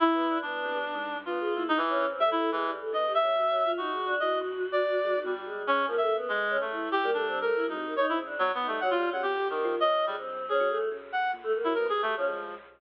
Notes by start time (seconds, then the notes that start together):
0.00 E4
0.11 A#2 B3
0.28 D4
0.42 B3 D4
0.64 C3
0.75 G3
0.84 B2
0.94 G#2
1.16 G2
1.26 B3 F4
1.40 G#4
1.54 A#2 E4
1.68 D#4
1.77 E3
1.89 C#4
2.00 C#3
2.10 C4
2.20 G3 A3 E5
2.31 E4
2.37 A4
2.51 A2 E3 G#3
2.65 G3
2.80 A4
2.92 D3 B3 D#5
3.08 G4
3.15 E5
3.21 G3 C#4
3.35 F#4
3.50 F#3
3.64 F4
3.77 D#4 F#4
3.92 G#3
4.06 D4
4.20 E3 F#4 D#5
4.41 F2
4.72 D5
5.04 G#3
5.15 D#3
5.24 B2 G3
5.45 G#3
5.67 G#2 C#4
5.87 F3 A#3
5.96 C#3 E5
6.01 A4
6.08 A#3
6.16 B3
6.29 F2 G#3
6.50 C#4
6.60 F#2 A3
6.71 E4
6.92 G2 G4
7.03 G3 A#3
7.13 A3 D4
7.27 C4
7.41 A3 A#4
7.55 E4
7.65 G#2 D#4 F#4
7.77 C3
7.86 A#3
7.96 D#4 C#5
8.09 C4 E4
8.18 C#3
8.25 D4
8.39 B2 F#3
8.54 B3
8.61 D#4
8.67 G3 A3
8.81 F#3 F#5
8.91 F4
8.95 G3
9.09 C#3 F#3 F#5
9.22 C3 G4
9.36 D3
9.50 D#3 G3 A#3
9.64 F3
9.79 C#4 D#5
10.06 D3 G3 G#3
10.17 G2 C4
10.49 A#2 C#4 G#4
10.60 F#3
10.69 A3
10.90 C#3
11.12 G2 F#5
11.33 A#2
11.43 F2 A3
11.54 A#3
11.64 F#3 E4
11.74 B3 A#4
11.86 F2 G4 G#4
12.02 G2 A3 G4
12.17 F3 C#4
12.28 G#3